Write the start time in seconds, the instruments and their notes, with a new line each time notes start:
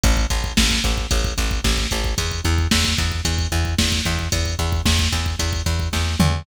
0.04 electric bass (finger) A1, kick, closed hi-hat
0.17 kick
0.30 electric bass (finger) A1, kick, closed hi-hat
0.44 kick
0.57 electric bass (finger) A1, kick, snare
0.71 kick
0.84 electric bass (finger) A1, kick, closed hi-hat
0.98 kick
1.11 electric bass (finger) A1, kick, closed hi-hat
1.24 kick
1.38 electric bass (finger) A1, kick, closed hi-hat
1.51 kick
1.64 electric bass (finger) A1, kick, snare
1.78 kick
1.91 electric bass (finger) A1, kick, closed hi-hat
2.04 kick
2.18 electric bass (finger) E2, kick, closed hi-hat
2.31 kick
2.45 electric bass (finger) E2, kick, closed hi-hat
2.58 kick
2.71 electric bass (finger) E2, kick, snare
2.85 kick
2.98 electric bass (finger) E2, kick, closed hi-hat
3.12 kick
3.25 electric bass (finger) E2, kick, closed hi-hat
3.39 kick
3.52 electric bass (finger) E2, kick, closed hi-hat
3.65 kick
3.78 electric bass (finger) E2, kick, snare
3.92 kick
4.05 electric bass (finger) E2, kick, closed hi-hat
4.19 kick
4.32 electric bass (finger) E2, kick, closed hi-hat
4.46 kick
4.59 electric bass (finger) E2, kick, closed hi-hat
4.72 kick
4.85 electric bass (finger) E2, kick, snare
4.99 kick
5.12 electric bass (finger) E2, kick, closed hi-hat
5.26 kick
5.39 electric bass (finger) E2, kick, closed hi-hat
5.53 kick
5.66 electric bass (finger) E2, kick, closed hi-hat
5.80 kick
5.93 electric bass (finger) E2, kick, snare
6.20 electric bass (finger) E2, mid tom